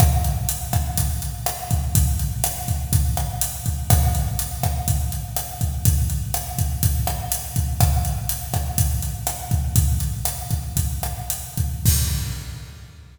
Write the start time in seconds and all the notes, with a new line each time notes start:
0.00 kick, cross-stick, closed hi-hat
0.24 closed hi-hat
0.49 closed hi-hat
0.73 kick, cross-stick, closed hi-hat
0.97 kick, closed hi-hat
1.22 closed hi-hat
1.46 cross-stick, closed hi-hat
1.71 kick, closed hi-hat
1.95 kick, closed hi-hat
2.19 closed hi-hat
2.44 cross-stick, closed hi-hat
2.68 kick, closed hi-hat
2.93 kick, closed hi-hat
3.17 cross-stick, closed hi-hat
3.41 closed hi-hat
3.66 kick, closed hi-hat
3.90 kick, cross-stick, closed hi-hat
4.15 closed hi-hat
4.39 closed hi-hat
4.63 kick, cross-stick, closed hi-hat
4.88 kick, closed hi-hat
5.12 closed hi-hat
5.36 cross-stick, closed hi-hat
5.61 kick, closed hi-hat
5.85 kick, closed hi-hat
6.10 closed hi-hat
6.34 cross-stick, closed hi-hat
6.58 kick, closed hi-hat
6.83 kick, closed hi-hat
7.07 cross-stick, closed hi-hat
7.32 closed hi-hat
7.56 kick, closed hi-hat
7.80 kick, cross-stick, closed hi-hat
8.05 closed hi-hat
8.29 closed hi-hat
8.54 kick, cross-stick, closed hi-hat
8.78 kick, closed hi-hat
9.02 closed hi-hat
9.27 cross-stick, closed hi-hat
9.51 kick, closed hi-hat
9.76 kick, closed hi-hat
10.00 closed hi-hat
10.25 cross-stick, closed hi-hat
10.51 kick, closed hi-hat
10.77 kick, closed hi-hat
11.03 cross-stick, closed hi-hat
11.30 closed hi-hat
11.57 kick, closed hi-hat
11.86 kick, crash